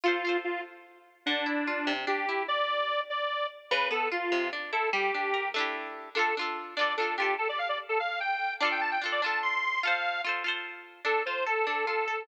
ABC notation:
X:1
M:6/8
L:1/16
Q:3/8=98
K:Dm
V:1 name="Lead 1 (square)"
F4 F2 z6 | D8 G4 | d6 d4 z2 | =B2 A2 ^E4 z2 A2 |
G6 z6 | A2 z4 d2 A2 G2 | A d f d z A f2 g4 | d g a g z d a2 c'4 |
f4 z8 | A2 c2 A2 A2 A4 |]
V:2 name="Pizzicato Strings"
[FAc]2 [FAc]10 | D,2 E2 F2 C,2 D2 E2 | z12 | ^C,2 =B,2 ^E2 =C,2 D2 =E2 |
G,2 D2 B2 [A,DEG]6 | [DFA]2 [DFA]4 [DFA]2 [DFA]2 [DFA]2 | z12 | [DFA]4 [DFA]2 [DFA]6 |
[FAc]4 [FAc]2 [FAc]6 | D2 F2 A2 D2 F2 A2 |]